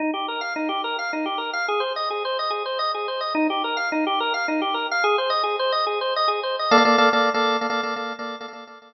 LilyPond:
\new Staff { \time 6/8 \key ees \mixolydian \tempo 4. = 143 ees'8 g'8 bes'8 f''8 ees'8 g'8 | bes'8 f''8 ees'8 g'8 bes'8 f''8 | aes'8 c''8 ees''8 aes'8 c''8 ees''8 | aes'8 c''8 ees''8 aes'8 c''8 ees''8 |
ees'8 g'8 bes'8 f''8 ees'8 g'8 | bes'8 f''8 ees'8 g'8 bes'8 f''8 | aes'8 c''8 ees''8 aes'8 c''8 ees''8 | aes'8 c''8 ees''8 aes'8 c''8 ees''8 |
\key bes \mixolydian <bes a' d'' f''>16 <bes a' d'' f''>16 <bes a' d'' f''>8 <bes a' d'' f''>8 <bes a' d'' f''>8. <bes a' d'' f''>8.~ | <bes a' d'' f''>16 <bes a' d'' f''>16 <bes a' d'' f''>8 <bes a' d'' f''>8 <bes a' d'' f''>8. <bes a' d'' f''>8. | <bes a' d'' f''>16 <bes a' d'' f''>16 <bes a' d'' f''>8 <bes a' d'' f''>8 <bes a' d'' f''>8. r8. | }